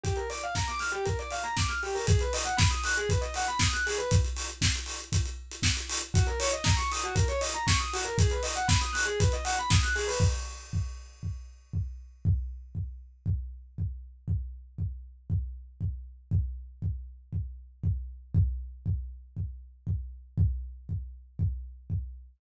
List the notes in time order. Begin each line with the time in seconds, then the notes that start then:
0.03 G4, kick, closed hi-hat
0.16 A#4, closed hi-hat
0.30 D5, open hi-hat
0.41 F5, closed hi-hat
0.55 A#5, kick, snare
0.67 D6, closed hi-hat
0.79 F6, open hi-hat
0.92 G4, closed hi-hat
1.05 A#4, kick, closed hi-hat
1.19 D5, closed hi-hat
1.31 F5, open hi-hat
1.43 A#5, closed hi-hat
1.57 D6, kick, snare
1.68 F6, closed hi-hat
1.83 G4, open hi-hat
1.95 A#4, open hi-hat
2.07 G#4, kick, closed hi-hat
2.19 B4, closed hi-hat
2.33 D#5, open hi-hat
2.44 F#5, closed hi-hat
2.57 B5, kick, snare
2.70 D#6, closed hi-hat
2.83 F#6, open hi-hat
2.97 G#4, closed hi-hat
3.09 B4, kick, closed hi-hat
3.21 D#5, closed hi-hat
3.34 F#5, open hi-hat
3.47 B5, closed hi-hat
3.59 D#6, kick, snare
3.73 F#6, closed hi-hat
3.86 G#4, open hi-hat
3.98 B4, closed hi-hat
4.11 kick, closed hi-hat
4.24 closed hi-hat
4.36 open hi-hat
4.49 closed hi-hat
4.61 kick, snare
4.75 closed hi-hat
4.86 open hi-hat
5.00 closed hi-hat
5.12 kick, closed hi-hat
5.25 closed hi-hat
5.51 closed hi-hat
5.63 kick, snare
5.77 closed hi-hat
5.89 open hi-hat
6.01 closed hi-hat
6.14 F#4, kick, closed hi-hat
6.27 A#4, closed hi-hat
6.40 C#5, open hi-hat
6.52 D#5, closed hi-hat
6.64 A#5, kick, snare
6.76 C#6, closed hi-hat
6.92 D#6, open hi-hat
7.03 F#4, closed hi-hat
7.15 A#4, kick, closed hi-hat
7.28 C#5, closed hi-hat
7.41 D#5, open hi-hat
7.54 A#5, closed hi-hat
7.67 C#6, kick, snare
7.79 D#6, closed hi-hat
7.93 F#4, open hi-hat
8.04 A#4, closed hi-hat
8.18 G#4, kick, closed hi-hat
8.30 B4, closed hi-hat
8.43 D#5, open hi-hat
8.56 F#5, closed hi-hat
8.68 B5, kick, snare
8.81 D#6, closed hi-hat
8.93 F#6, open hi-hat
9.05 G#4, closed hi-hat
9.20 B4, kick, closed hi-hat
9.32 D#5, closed hi-hat
9.44 F#5, open hi-hat
9.57 B5, closed hi-hat
9.70 D#6, kick, snare
9.83 F#6, closed hi-hat
9.95 G#4, open hi-hat
10.08 B4, open hi-hat
10.20 kick
10.73 kick
11.23 kick
11.73 kick
12.25 kick
12.75 kick
13.26 kick
13.78 kick
14.28 kick
14.78 kick
15.30 kick
15.81 kick
16.31 kick
16.82 kick
17.33 kick
17.83 kick
18.35 kick
18.86 kick
19.37 kick
19.87 kick
20.38 kick
20.89 kick
21.39 kick
21.90 kick